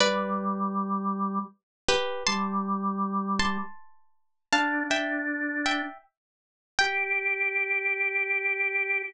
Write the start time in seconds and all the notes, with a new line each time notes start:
0.00 G3 B4 D5
1.89 G4 B4
2.27 G3 A5 C6
3.39 A5 C6
4.53 D4 F5 A5
4.90 D4 E5 G5
5.66 E5 G5
6.79 G4 G5